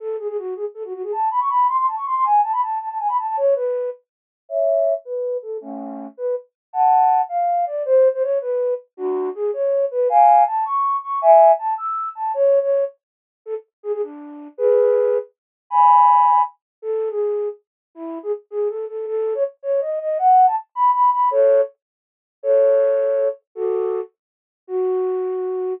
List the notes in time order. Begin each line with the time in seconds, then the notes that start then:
0.00 A4
0.19 G#4
0.28 G#4
0.38 F#4
0.56 G#4
0.74 A4
0.84 F#4
0.93 F#4
1.03 G#4
1.12 A5
1.31 B5
1.40 C#6
1.49 B5
1.68 C6
1.77 C6
1.87 A5
1.96 C#6
2.06 C6
2.15 C6
2.24 G#5
2.43 A5
2.52 B5
2.62 A5
2.80 A5
2.89 A5
2.99 G#5
3.08 B5
3.18 A5
3.27 A5
3.37 C#5
3.55 B4
4.49 C#5 E5
5.05 B4
5.42 A4
5.61 A3 C#4
6.17 B4
6.73 F#5 A5
7.29 F5
7.66 D5
7.85 C5
8.14 C5
8.23 C#5
8.41 B4
8.97 D4 F#4
9.35 G#4
9.53 C#5
9.91 B4
10.09 F5 G#5
10.47 A5
10.65 C#6
11.03 C#6
11.21 E5 G#5
11.59 A5
11.78 E6
12.15 A5
12.34 C#5
12.62 C#5
13.46 A4
13.83 G#4
13.93 G#4
14.02 D4
14.57 G#4 B4
15.70 G#5 B5
16.82 A4
17.10 G#4
17.95 E4
18.23 G#4
18.50 G#4
18.69 A4
18.88 A4
19.07 A4
19.35 C#5
19.63 C#5
19.81 D#5
20.00 D#5
20.19 F#5
20.47 A5
20.75 B5
20.94 B5
21.12 B5
21.31 A4 C#5
22.43 A4 C#5
23.55 F#4 A4
24.67 F#4